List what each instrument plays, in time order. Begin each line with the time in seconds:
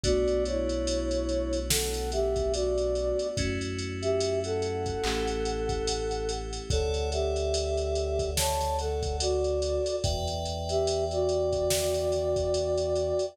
0.03 synth bass 2 B1, electric piano 2 A3 B3 D4 F#4, flute F#4 D5, kick, closed hi-hat
0.28 closed hi-hat
0.45 flute E4 C#5, closed hi-hat
0.69 closed hi-hat
0.87 closed hi-hat
1.11 closed hi-hat
1.29 closed hi-hat
1.53 closed hi-hat
1.69 flute A4 F#5, snare
1.94 closed hi-hat
2.12 flute G4 E5, closed hi-hat
2.36 kick, closed hi-hat
2.53 flute F#4 D5, closed hi-hat
2.78 closed hi-hat
2.95 closed hi-hat
3.19 closed hi-hat
3.37 synth bass 2 F#2, electric piano 2 A3 C#4 E4 F#4, kick, closed hi-hat
3.61 closed hi-hat
3.79 closed hi-hat
4.02 flute G4 E5, closed hi-hat
4.20 closed hi-hat
4.44 flute A4 F#5, closed hi-hat
4.62 closed hi-hat
4.86 kick, closed hi-hat
5.04 synth bass 2 A1, electric piano 2 A3 C#4 E4 G4, clap
5.27 closed hi-hat
5.45 closed hi-hat
5.69 kick, closed hi-hat
5.87 closed hi-hat
6.11 closed hi-hat
6.29 closed hi-hat
6.53 closed hi-hat
6.70 synth bass 2 D2, flute A4 F#5, electric piano 2 A4 C#5 D5 F#5, kick, closed hi-hat
6.94 closed hi-hat
7.12 flute G4 E5, closed hi-hat
7.36 closed hi-hat
7.54 closed hi-hat
7.77 closed hi-hat
7.95 closed hi-hat
8.19 kick, closed hi-hat
8.37 flute C#5 A5, snare
8.61 snare, closed hi-hat
8.79 flute A4 F#5, closed hi-hat
9.03 kick, closed hi-hat
9.20 flute F#4 D5, closed hi-hat
9.44 closed hi-hat
9.62 closed hi-hat
9.86 closed hi-hat
10.03 synth bass 2 E2, electric piano 2 B4 D5 E5 G5, kick, closed hi-hat
10.28 closed hi-hat
10.45 closed hi-hat
10.69 flute G4 E5, closed hi-hat
10.87 closed hi-hat
11.11 flute F#4 D5, closed hi-hat
11.29 closed hi-hat
11.53 kick, closed hi-hat
11.70 snare
11.94 closed hi-hat
12.12 closed hi-hat
12.36 kick, closed hi-hat
12.54 closed hi-hat
12.78 closed hi-hat
12.95 closed hi-hat
13.19 closed hi-hat